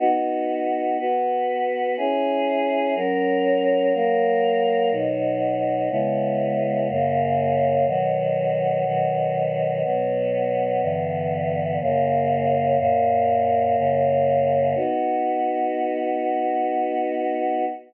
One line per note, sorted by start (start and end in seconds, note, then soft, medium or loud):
0.00 0.97 B3 medium
0.00 0.97 D#4 loud
0.00 0.97 F#4 loud
0.99 1.96 B3 medium
0.99 1.96 F#4 loud
0.99 1.96 B4 medium
1.97 2.94 C#4 medium
1.97 2.94 E4 medium
1.97 2.94 G#4 loud
2.95 3.92 F#3 medium
2.95 3.92 C#4 medium
2.95 3.92 A#4 medium
3.94 4.91 F#3 medium
3.94 4.91 A#3 medium
3.94 4.91 A#4 loud
4.91 5.89 B2 loud
4.91 5.89 F#3 medium
4.91 5.89 D#4 loud
5.90 6.88 C#3 loud
5.90 6.88 G#3 medium
5.90 6.88 B3 medium
5.90 6.88 E4 loud
6.89 7.86 F#2 medium
6.89 7.86 C#3 loud
6.89 7.86 A#3 medium
7.87 8.84 B2 loud
7.87 8.84 D#3 medium
7.87 8.84 F#3 loud
8.85 9.83 B2 loud
8.85 9.83 D#3 loud
8.85 9.83 F#3 medium
9.84 10.81 B2 medium
9.84 10.81 F#3 medium
9.84 10.81 B3 medium
10.82 11.79 G2 loud
10.82 11.79 D3 medium
10.82 11.79 E3 loud
10.82 11.79 B3 medium
11.80 12.78 F#2 medium
11.80 12.78 C#3 medium
11.80 12.78 A#3 loud
12.79 13.76 F#2 loud
12.79 13.76 A#2 loud
12.79 13.76 A#3 loud
13.77 14.74 F#2 loud
13.77 14.74 C#3 loud
13.77 14.74 A#3 medium
14.75 17.65 B3 loud
14.75 17.65 D#4 loud
14.75 17.65 F#4 loud